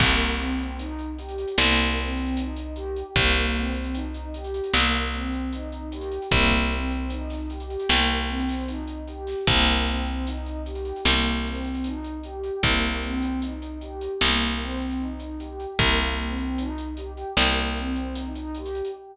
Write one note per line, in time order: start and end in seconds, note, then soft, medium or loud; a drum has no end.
0.00 1.45 C2 medium
0.00 0.35 A#3 medium
0.00 kick loud
0.00 crash loud
0.20 closed hi-hat medium
0.39 0.75 C4 medium
0.39 closed hi-hat medium
0.59 closed hi-hat medium
0.79 1.14 D#4 medium
0.79 closed hi-hat loud
0.99 closed hi-hat medium
1.18 1.54 G4 medium
1.18 closed hi-hat medium
1.29 closed hi-hat medium
1.38 closed hi-hat medium
1.48 closed hi-hat medium
1.58 3.03 C2 medium
1.58 1.93 A#3 medium
1.58 snare loud
1.78 closed hi-hat medium
1.97 2.33 C4 medium
1.97 closed hi-hat medium
2.07 closed hi-hat medium
2.17 closed hi-hat medium
2.26 closed hi-hat medium
2.37 2.73 D#4 medium
2.37 closed hi-hat loud
2.57 closed hi-hat medium
2.76 3.12 G4 medium
2.76 closed hi-hat medium
2.96 closed hi-hat medium
3.16 4.61 C2 medium
3.16 3.51 A#3 medium
3.16 kick loud
3.16 closed hi-hat loud
3.35 closed hi-hat medium
3.56 3.91 C4 medium
3.56 closed hi-hat medium
3.64 closed hi-hat medium
3.75 closed hi-hat medium
3.84 closed hi-hat medium
3.94 4.31 D#4 medium
3.94 closed hi-hat loud
4.14 closed hi-hat medium
4.34 4.70 G4 medium
4.34 closed hi-hat medium
4.44 closed hi-hat medium
4.54 closed hi-hat medium
4.64 closed hi-hat medium
4.74 6.19 C2 medium
4.74 5.10 A#3 medium
4.74 snare loud
4.93 closed hi-hat medium
5.13 5.48 C4 medium
5.13 closed hi-hat medium
5.33 closed hi-hat medium
5.53 5.88 D#4 medium
5.53 closed hi-hat loud
5.72 closed hi-hat medium
5.92 6.28 G4 medium
5.92 closed hi-hat loud
6.01 closed hi-hat medium
6.12 closed hi-hat medium
6.22 closed hi-hat medium
6.31 7.77 C2 medium
6.31 6.67 A#3 medium
6.31 kick loud
6.31 closed hi-hat loud
6.51 kick medium
6.51 snare soft
6.51 closed hi-hat medium
6.71 7.07 C4 medium
6.71 closed hi-hat medium
6.90 closed hi-hat medium
7.10 7.46 D#4 medium
7.10 closed hi-hat loud
7.30 snare soft
7.30 closed hi-hat medium
7.50 7.86 G4 medium
7.50 closed hi-hat medium
7.60 closed hi-hat medium
7.70 closed hi-hat medium
7.80 closed hi-hat medium
7.89 9.35 C2 medium
7.89 8.26 A#3 medium
7.89 snare loud
8.09 closed hi-hat medium
8.28 8.64 C4 medium
8.28 closed hi-hat medium
8.39 closed hi-hat medium
8.49 snare medium
8.49 closed hi-hat medium
8.59 closed hi-hat medium
8.68 9.04 D#4 medium
8.68 closed hi-hat loud
8.88 closed hi-hat medium
9.08 9.43 G4 medium
9.08 closed hi-hat medium
9.27 snare soft
9.27 closed hi-hat medium
9.47 10.93 C2 loud
9.47 9.83 A#3 medium
9.47 kick loud
9.47 closed hi-hat loud
9.67 closed hi-hat medium
9.87 10.22 C4 medium
9.87 snare soft
9.87 closed hi-hat medium
10.06 closed hi-hat medium
10.27 10.62 D#4 medium
10.27 closed hi-hat loud
10.46 closed hi-hat medium
10.66 11.01 G4 medium
10.66 closed hi-hat medium
10.75 closed hi-hat medium
10.85 closed hi-hat medium
10.96 closed hi-hat medium
11.04 12.51 C2 medium
11.04 11.40 A#3 medium
11.04 snare loud
11.25 closed hi-hat medium
11.45 11.81 C4 medium
11.45 closed hi-hat medium
11.55 closed hi-hat medium
11.65 closed hi-hat medium
11.74 closed hi-hat medium
11.84 12.19 D#4 medium
11.84 closed hi-hat loud
12.04 closed hi-hat medium
12.24 12.60 G4 medium
12.24 closed hi-hat medium
12.44 closed hi-hat medium
12.63 14.08 C2 medium
12.63 12.99 A#3 medium
12.63 kick loud
12.63 closed hi-hat loud
12.83 closed hi-hat medium
13.02 13.38 C4 medium
13.02 closed hi-hat medium
13.22 closed hi-hat medium
13.42 13.78 D#4 medium
13.42 closed hi-hat loud
13.62 closed hi-hat medium
13.81 14.17 G4 medium
13.81 closed hi-hat medium
14.01 closed hi-hat medium
14.21 15.66 C2 medium
14.21 14.57 A#3 medium
14.21 snare loud
14.41 closed hi-hat medium
14.60 14.96 C4 medium
14.60 closed hi-hat medium
14.70 closed hi-hat medium
14.80 closed hi-hat medium
14.90 closed hi-hat medium
15.00 15.35 D#4 medium
15.00 closed hi-hat medium
15.20 closed hi-hat medium
15.39 15.75 G4 medium
15.39 closed hi-hat medium
15.60 closed hi-hat medium
15.79 17.24 C2 medium
15.79 16.15 A#3 medium
15.79 kick loud
15.79 closed hi-hat loud
15.99 closed hi-hat medium
16.18 16.54 C4 medium
16.18 closed hi-hat medium
16.38 closed hi-hat medium
16.58 16.93 D#4 medium
16.58 closed hi-hat loud
16.78 closed hi-hat medium
16.97 17.33 G4 medium
16.97 closed hi-hat medium
17.17 closed hi-hat medium
17.37 18.82 C2 medium
17.37 17.73 A#3 medium
17.37 snare loud
17.57 closed hi-hat medium
17.77 18.13 C4 medium
17.77 closed hi-hat medium
17.96 closed hi-hat medium
18.15 18.51 D#4 medium
18.15 closed hi-hat loud
18.35 closed hi-hat medium
18.55 18.91 G4 medium
18.55 closed hi-hat medium
18.66 closed hi-hat medium
18.75 closed hi-hat medium
18.85 closed hi-hat medium